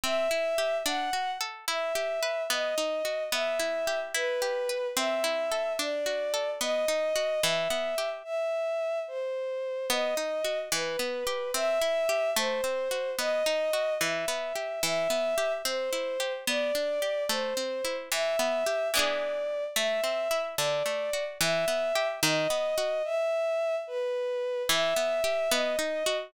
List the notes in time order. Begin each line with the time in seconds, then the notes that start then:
0.04 C4 E5
0.31 E4
0.58 G4
0.85 D4 F#5
1.13 F#4
1.41 A4
1.67 E4 E5
1.95 G4
2.23 B4
2.50 B3 D#5
2.78 D#4
3.05 F#4
3.32 B3 E5
3.59 E4
3.87 G4
4.14 E4 B4
4.42 G4
4.69 B4
4.97 C4 E5
5.24 E4
5.52 A4
5.79 D4 D5
6.06 F#4
6.34 A4
6.61 B3 D#5
6.88 D#4
7.16 F#4
7.43 E3 E5
7.70 B3
7.98 G4
8.24 E5
9.08 C5
9.90 B3 D#5
10.17 D#4
10.45 F#4
10.72 E3 B4
10.99 B3
11.27 G4
11.54 C4 E5
11.82 E4
12.09 G4
12.36 A3 C5
12.64 C4
12.91 F#4
13.18 B3 D#5
13.46 D#4
13.73 F#4
14.01 E3 E5
14.28 B3
14.55 G4
14.83 E3 E5
15.10 B3
15.38 G4
15.65 C4 C5
15.93 E4
16.20 G4
16.47 B3 D5
16.75 D4
17.02 G4
17.29 A3 C5
17.57 C4
17.85 E4
18.11 E3 E5
18.39 B3
18.66 G4
18.94 E3 B3 D4 D5
18.99 G#4
19.76 A3 E5
20.04 C4
20.31 E4
20.58 D3 D5
20.86 A3
21.13 F#4
21.40 E3 E5
21.68 B3
21.95 G4
22.23 D#3 D#5
22.50 B3
22.78 F#4
23.04 E5
23.87 B4
24.69 E3 E5
24.96 B3
25.24 G4
25.51 B3 D#5
25.79 D#4
26.06 F#4